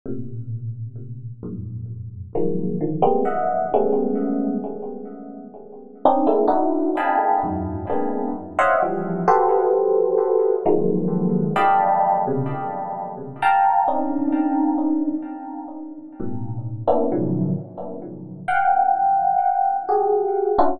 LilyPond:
\new Staff { \time 5/8 \tempo 4 = 65 <a, bes, c>4. <f, ges, g, aes, bes,>4 | <ees f ges aes bes>8 <d ees f>16 <g aes bes b c'>16 <ees'' e'' ges''>8 <g aes a b des'>4 | r4. <c' des' d' ees'>16 <aes a bes c' d' e'>16 <d' ees' e' ges'>8 | <ees'' f'' g'' aes'' a'' b''>8 <e, ges, aes,>8 <aes bes b c' d'>8 r16 <c'' des'' ees'' e'' f'' ges''>16 <e f g>8 |
<ges' g' a' b' c''>4. <ees f ges aes bes>4 | <d'' ees'' f'' g'' a'' b''>8. <b, c des>16 r4 <f'' g'' a'' bes''>8 | <c' des' d' ees'>4. r4 | <g, a, b,>8. <bes b des' d' e'>16 <a, b, des ees f ges>8 r4 |
<f'' ges'' g''>4. <ges' g' aes'>8. <des' d' e' f' ges'>16 | }